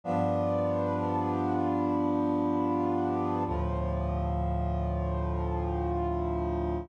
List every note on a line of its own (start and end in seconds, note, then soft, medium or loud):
0.04 3.43 G2 medium
0.04 3.43 F3 medium
0.04 3.43 B3 medium
0.04 3.43 D4 medium
3.46 6.86 D2 medium
3.46 6.86 A2 medium
3.46 6.86 F3 medium